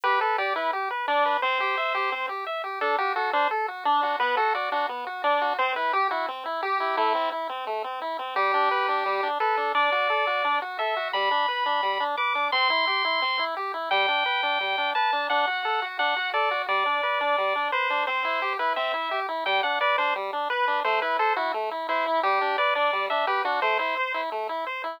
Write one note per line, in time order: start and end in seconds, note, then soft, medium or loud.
0.03 0.19 G4 medium
0.03 0.20 B4 medium
0.21 0.37 A4 medium
0.21 0.36 B4 medium
0.38 0.53 G4 medium
0.38 0.54 D5 medium
0.56 0.71 E4 medium
0.56 0.71 B4 medium
0.73 0.89 G4 medium
0.90 1.06 B4 medium
1.08 1.37 D4 medium
1.08 1.23 D5 medium
1.25 1.41 B4 medium
1.42 1.58 C4 medium
1.42 2.26 C5 medium
1.60 1.75 G4 medium
1.77 1.92 E5 medium
1.94 2.10 G4 medium
2.12 2.27 C4 medium
2.29 2.44 G4 medium
2.46 2.62 E5 medium
2.64 2.79 G4 medium
2.81 2.97 D4 medium
2.81 2.96 A4 medium
2.98 3.14 F#4 medium
2.98 3.13 G4 medium
3.16 3.30 F#4 medium
3.16 3.31 A4 medium
3.33 3.48 D4 medium
3.33 3.49 C5 medium
3.50 3.66 A4 medium
3.68 3.83 F#4 medium
3.85 4.01 D4 medium
3.85 4.16 D4 medium
4.02 4.18 F#4 medium
4.20 4.35 B3 medium
4.20 4.35 B4 medium
4.37 4.53 F#4 medium
4.37 4.54 A4 medium
4.54 4.69 F#4 medium
4.54 4.70 D5 medium
4.72 4.86 D4 medium
4.72 4.87 F#4 medium
4.89 5.05 B3 medium
5.07 5.22 F#4 medium
5.24 5.53 D4 medium
5.24 5.39 D5 medium
5.41 5.57 F#4 medium
5.59 5.74 C4 medium
5.59 5.73 C5 medium
5.76 5.91 E4 medium
5.76 5.93 B4 medium
5.93 6.09 G4 medium
5.93 6.08 G4 medium
6.10 6.26 E4 medium
6.10 6.26 F#4 medium
6.28 6.43 C4 medium
6.45 6.61 E4 medium
6.62 6.78 G4 medium
6.62 6.96 G4 medium
6.80 6.95 E4 medium
6.97 7.13 A3 medium
6.97 7.30 E4 medium
7.15 7.30 C4 medium
7.32 7.48 E4 medium
7.49 7.65 C4 medium
7.67 7.82 A3 medium
7.84 7.99 C4 medium
8.01 8.17 E4 medium
8.18 8.34 C4 medium
8.36 8.51 G3 medium
8.36 9.28 G4 loud
8.53 8.69 D4 medium
8.71 8.86 B4 medium
8.88 9.04 D4 medium
9.05 9.21 G3 medium
9.23 9.38 D4 medium
9.40 9.72 A4 medium
9.40 9.56 B4 medium
9.57 9.73 D4 medium
9.74 9.90 D4 medium
9.74 10.59 D5 medium
9.92 10.08 F#4 medium
10.09 10.25 A4 medium
10.27 10.42 F#4 medium
10.44 10.60 D4 medium
10.61 10.77 F#4 medium
10.79 10.94 A4 medium
10.79 11.08 E5 medium
10.96 11.12 F#4 medium
11.13 11.29 G3 medium
11.13 12.04 B5 medium
11.31 11.46 D4 medium
11.48 11.64 B4 medium
11.66 11.81 D4 medium
11.83 11.98 G3 medium
12.00 12.16 D4 medium
12.17 12.33 B4 medium
12.17 12.48 D6 medium
12.35 12.50 D4 medium
12.52 12.68 C4 medium
12.52 13.44 C6 loud
12.70 12.85 E4 medium
12.87 13.02 G4 medium
13.04 13.20 E4 medium
13.21 13.37 C4 medium
13.39 13.54 E4 medium
13.56 13.72 G4 medium
13.74 13.89 E4 medium
13.91 14.06 G3 medium
13.91 14.91 G5 loud
14.08 14.24 D4 medium
14.26 14.41 B4 medium
14.43 14.58 D4 medium
14.60 14.76 G3 medium
14.78 14.93 D4 medium
14.95 15.11 B4 medium
14.95 15.27 A5 medium
15.12 15.28 D4 medium
15.30 15.45 D4 medium
15.30 15.86 F#5 medium
15.47 15.63 F#4 medium
15.64 15.80 A4 medium
15.82 15.97 F#4 medium
15.99 16.14 D4 medium
15.99 16.30 F#5 medium
16.16 16.32 F#4 medium
16.34 16.49 A4 medium
16.34 16.62 D5 medium
16.51 16.66 F#4 medium
16.68 16.84 G3 medium
16.68 17.68 D5 medium
16.86 17.01 D4 medium
17.03 17.19 B4 medium
17.20 17.36 D4 medium
17.38 17.53 G3 medium
17.55 17.71 D4 medium
17.72 17.88 B4 medium
17.72 18.04 C5 medium
17.90 18.05 D4 medium
18.07 18.23 C4 medium
18.07 18.53 C5 medium
18.24 18.40 E4 medium
18.42 18.57 G4 medium
18.59 18.75 E4 medium
18.59 18.73 B4 medium
18.76 18.92 C4 medium
18.76 19.20 E5 medium
18.94 19.09 E4 medium
19.11 19.27 G4 medium
19.28 19.44 E4 medium
19.46 19.61 G3 medium
19.46 19.61 G5 medium
19.63 19.79 D4 medium
19.63 19.79 F#5 medium
19.81 19.96 B4 medium
19.81 19.97 D5 medium
19.98 20.13 D4 medium
19.98 20.14 C5 medium
20.15 20.31 G3 medium
20.32 20.48 D4 medium
20.50 20.65 B4 medium
20.50 20.80 B4 medium
20.67 20.83 D4 medium
20.84 21.00 A3 medium
20.84 21.00 C5 medium
21.02 21.18 E4 medium
21.02 21.17 B4 medium
21.19 21.33 A4 medium
21.19 21.35 C5 medium
21.36 21.52 E4 medium
21.36 21.52 F#4 medium
21.54 21.69 A3 medium
21.71 21.87 E4 medium
21.88 22.20 E4 medium
21.88 22.04 C5 medium
22.06 22.21 E4 medium
22.23 22.39 G3 medium
22.23 22.57 G4 loud
22.41 22.56 D4 medium
22.58 22.74 B4 medium
22.58 22.74 D5 medium
22.75 22.91 D4 medium
22.75 23.06 D5 medium
22.93 23.08 G3 medium
23.10 23.26 D4 medium
23.10 23.26 E5 medium
23.27 23.42 G4 medium
23.27 23.43 B4 medium
23.45 23.60 D4 medium
23.45 23.60 F#4 medium
23.62 23.77 A3 medium
23.62 23.78 C5 medium
23.79 23.95 E4 medium
23.79 24.21 C5 medium
23.97 24.12 C5 medium
24.14 24.29 E4 medium
24.31 24.47 A3 medium
24.49 24.64 E4 medium
24.66 24.82 C5 medium
24.83 24.99 E4 medium